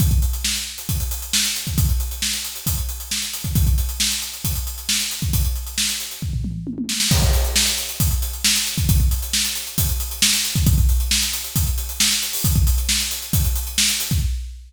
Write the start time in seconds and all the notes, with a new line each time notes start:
0.00 kick, closed hi-hat
0.11 kick, closed hi-hat
0.22 closed hi-hat
0.33 closed hi-hat
0.44 snare
0.56 closed hi-hat
0.78 closed hi-hat
0.89 kick, closed hi-hat
1.00 closed hi-hat
1.11 closed hi-hat
1.22 closed hi-hat
1.33 snare
1.44 closed hi-hat
1.56 closed hi-hat
1.67 kick, closed hi-hat
1.78 kick, closed hi-hat
1.89 closed hi-hat
2.00 closed hi-hat
2.11 closed hi-hat
2.22 snare
2.33 closed hi-hat
2.44 closed hi-hat
2.56 closed hi-hat
2.66 kick, closed hi-hat
2.78 closed hi-hat
2.89 closed hi-hat
3.00 closed hi-hat
3.11 snare
3.22 closed hi-hat
3.33 closed hi-hat
3.44 kick, closed hi-hat
3.55 kick, closed hi-hat
3.67 kick, closed hi-hat
3.78 closed hi-hat
3.89 closed hi-hat
4.00 snare
4.11 closed hi-hat
4.22 closed hi-hat
4.33 closed hi-hat
4.44 kick, closed hi-hat
4.55 closed hi-hat
4.67 closed hi-hat
4.78 closed hi-hat
4.89 snare
5.00 closed hi-hat
5.11 closed hi-hat
5.22 kick, closed hi-hat
5.33 kick, closed hi-hat
5.45 closed hi-hat
5.56 closed hi-hat
5.67 closed hi-hat
5.78 snare
5.89 closed hi-hat
6.00 closed hi-hat
6.11 closed hi-hat
6.22 kick
6.33 floor tom
6.44 mid tom
6.67 high tom
6.78 high tom
6.89 snare
7.00 snare
7.11 kick, crash
7.22 kick, closed hi-hat
7.33 closed hi-hat
7.45 closed hi-hat
7.56 snare
7.67 closed hi-hat
7.78 closed hi-hat
7.89 closed hi-hat
8.00 kick, closed hi-hat
8.11 closed hi-hat
8.22 closed hi-hat
8.33 closed hi-hat
8.44 snare
8.55 closed hi-hat
8.66 closed hi-hat
8.78 kick, closed hi-hat
8.89 kick, closed hi-hat
9.00 kick, closed hi-hat
9.11 closed hi-hat
9.22 closed hi-hat
9.33 snare
9.45 closed hi-hat
9.55 closed hi-hat
9.67 closed hi-hat
9.78 kick, closed hi-hat
9.89 closed hi-hat
10.00 closed hi-hat
10.11 closed hi-hat
10.22 snare
10.33 closed hi-hat
10.44 closed hi-hat
10.55 kick, closed hi-hat
10.66 kick, closed hi-hat
10.78 kick, closed hi-hat
10.89 closed hi-hat
11.00 closed hi-hat
11.11 snare
11.22 closed hi-hat
11.33 closed hi-hat
11.44 closed hi-hat
11.56 kick, closed hi-hat
11.67 closed hi-hat
11.78 closed hi-hat
11.89 closed hi-hat
12.00 snare, closed hi-hat
12.11 closed hi-hat
12.22 closed hi-hat
12.33 open hi-hat
12.44 kick, closed hi-hat
12.55 kick, closed hi-hat
12.67 closed hi-hat
12.78 closed hi-hat
12.89 snare
13.00 closed hi-hat
13.11 closed hi-hat
13.22 closed hi-hat
13.33 kick, closed hi-hat
13.45 closed hi-hat
13.56 closed hi-hat
13.67 closed hi-hat
13.78 snare
13.89 closed hi-hat
14.00 closed hi-hat
14.11 kick, closed hi-hat